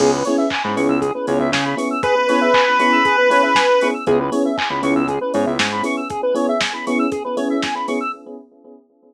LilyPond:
<<
  \new Staff \with { instrumentName = "Lead 1 (square)" } { \time 4/4 \key cis \minor \tempo 4 = 118 r1 | b'1 | r1 | r1 | }
  \new Staff \with { instrumentName = "Electric Piano 1" } { \time 4/4 \key cis \minor <b cis' e' gis'>8 <b cis' e' gis'>4 <b cis' e' gis'>4 <b cis' e' gis'>4 <b cis' e' gis'>8~ | <b cis' e' gis'>8 <b cis' e' gis'>4 <b cis' e' gis'>4 <b cis' e' gis'>4 <b cis' e' gis'>8 | <b cis' e' gis'>8 <b cis' e' gis'>4 <b cis' e' gis'>4 <b cis' e' gis'>4 <b cis' e' gis'>8~ | <b cis' e' gis'>8 <b cis' e' gis'>4 <b cis' e' gis'>4 <b cis' e' gis'>4 <b cis' e' gis'>8 | }
  \new Staff \with { instrumentName = "Lead 1 (square)" } { \time 4/4 \key cis \minor gis'16 b'16 cis''16 e''16 gis''16 b''16 cis'''16 e'''16 gis'16 b'16 cis''16 e''16 gis''16 b''16 cis'''16 e'''16 | gis'16 b'16 cis''16 e''16 gis''16 b''16 cis'''16 e'''16 gis'16 b'16 cis''16 e''16 gis''16 b''16 cis'''16 e'''16 | gis'16 b'16 cis''16 e''16 gis''16 b''16 cis'''16 e'''16 gis'16 b'16 cis''16 e''16 gis''16 b''16 cis'''16 e'''16 | gis'16 b'16 cis''16 e''16 gis''16 b''16 cis'''16 e'''16 gis'16 b'16 cis''16 e''16 gis''16 b''16 cis'''16 e'''16 | }
  \new Staff \with { instrumentName = "Synth Bass 1" } { \clef bass \time 4/4 \key cis \minor cis,4~ cis,16 gis,16 cis,16 cis,8. cis,16 cis,16 cis4~ | cis1 | cis,4~ cis,16 cis,16 cis,16 cis,8. gis,16 cis,16 gis,4~ | gis,1 | }
  \new DrumStaff \with { instrumentName = "Drums" } \drummode { \time 4/4 <cymc bd>8 hho8 <hc bd>8 hho8 <hh bd>8 hho8 <bd sn>8 hho8 | <hh bd>8 hho8 <hc bd>8 hho8 <hh bd>8 hho8 <bd sn>8 hho8 | <hh bd>8 hho8 <hc bd>8 hho8 <hh bd>8 hho8 <bd sn>8 hho8 | <hh bd>8 hho8 <bd sn>8 hho8 <hh bd>8 hho8 <bd sn>8 hho8 | }
>>